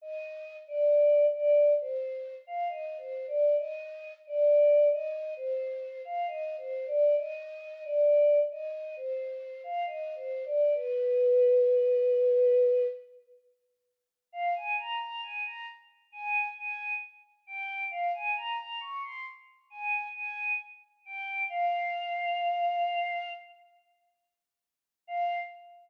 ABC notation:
X:1
M:4/4
L:1/16
Q:1/4=67
K:Cm
V:1 name="Choir Aahs"
e3 d3 d2 c3 f (3e2 c2 d2 | e3 d3 e2 c3 f (3e2 c2 d2 | e3 d3 e2 c3 f (3e2 c2 d2 | =B10 z6 |
[K:Fm] f a b b a b z2 a2 a2 z2 g2 | f a b b d' c' z2 a2 a2 z2 g2 | f10 z6 | f4 z12 |]